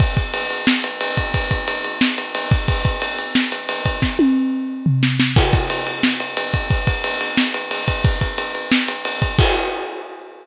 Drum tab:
CC |--------|--------|--------|--------|
RD |xxxx-xxx|xxxx-xxx|xxxx-xxx|--------|
SD |----o---|----o---|----o---|o-----oo|
T1 |--------|--------|--------|-o------|
FT |--------|--------|--------|-----o--|
BD |oo-----o|oo-----o|oo-----o|o-------|

CC |x-------|--------|--------|x-------|
RD |-xxx-xxx|xxxx-xxx|xxxx-xxx|--------|
SD |----o---|----o---|----o---|--------|
T1 |--------|--------|--------|--------|
FT |--------|--------|--------|--------|
BD |oo-----o|oo-----o|oo-----o|o-------|